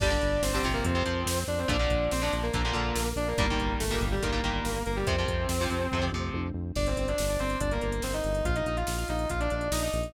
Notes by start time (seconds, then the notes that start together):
0.00 G1 D3 G3 D4 D5, kick, crash
0.10 D3 G3
0.21 G1, closed hi-hat
0.42 G1 C4 C5, snare
0.53 D3 G3 C4 C5
0.63 G1 C3 F3, kick, closed hi-hat
0.74 A#3 A#4
0.84 F2 C4 C5, kick, closed hi-hat
0.95 C3 F3
1.06 F2 C3 F3, closed hi-hat
1.26 F2, snare
1.47 F2 D4 D5, closed hi-hat
1.58 C4 C5
1.68 A#1 A#2 D3 F3 D4 D5, kick, closed hi-hat
1.79 A#2 D3 F3
1.90 A#1, kick, closed hi-hat
2.11 A#1 C4 C5, snare
2.22 A#2 D3 F3 D4 D5
2.33 A#1, closed hi-hat
2.43 A#3 A#4
2.53 A#1 A#2 D3 F3 A#3 A#4, kick, closed hi-hat
2.65 A#2 D3 F3
2.73 A#1 A#2 D3 F3, closed hi-hat
2.96 A#1, snare
3.16 A#1 D4 D5, closed hi-hat
3.28 A#3 A#4
3.38 G1 A#2 D#3 G3 A#3 A#4, kick, closed hi-hat
3.50 A#2 D#3 G3
3.59 G1, kick, closed hi-hat
3.80 G1 A3 A4, snare
3.90 A#2 D#3 G3 A#3 A#4
4.01 G1, kick, closed hi-hat
4.12 G3 G4
4.22 G1 A#2 D#3 G3 A#3 A#4, kick, closed hi-hat
4.32 A#2 D#3 G3
4.44 G1 A#2 D#3 G3, closed hi-hat
4.65 G1, snare
4.86 G1 A#3 A#4, closed hi-hat
4.96 G3 G4
5.07 F2 C3 F3 C4 C5, kick, closed hi-hat
5.18 C3 F3
5.28 F2, kick, closed hi-hat
5.49 F2, snare
5.61 C3 F3
5.70 F2, closed hi-hat
5.91 F2 C3 F3, kick, floor tom
6.02 C3 F3
6.12 F2 C3 F3, mid tom
6.34 F2, high tom
6.54 F2
6.76 G1 D4 D5, kick, crash
6.86 C4 C5, closed hi-hat
6.97 G1 C4 C5, closed hi-hat
7.08 D4 D5, closed hi-hat
7.18 G1, snare
7.29 D4 D5, closed hi-hat
7.39 G1 C4 C5, closed hi-hat
7.50 closed hi-hat
7.60 G1 D4 D5, kick, closed hi-hat
7.71 A#3 A#4, closed hi-hat
7.81 G1 A#3 A#4, closed hi-hat
7.92 closed hi-hat
8.02 G1 C4 C5, snare
8.13 D#4 D#5, closed hi-hat
8.24 G1, closed hi-hat
8.35 closed hi-hat
8.45 A#1 F4 F5, kick, closed hi-hat
8.55 D#4 D#5, closed hi-hat
8.66 A#1 D#4 D#5, closed hi-hat
8.77 F4 F5, closed hi-hat
8.87 A#1, snare
8.98 F4 F5, closed hi-hat
9.08 A#1 D#4 D#5, closed hi-hat
9.19 closed hi-hat
9.29 A#1 F4 F5, kick, closed hi-hat
9.40 D4 D5, closed hi-hat
9.50 A#1 D4 D5, closed hi-hat
9.61 closed hi-hat
9.71 A#1 D#4 D#5, snare
9.82 D#4 D#5, closed hi-hat
9.93 A#1, closed hi-hat
10.03 closed hi-hat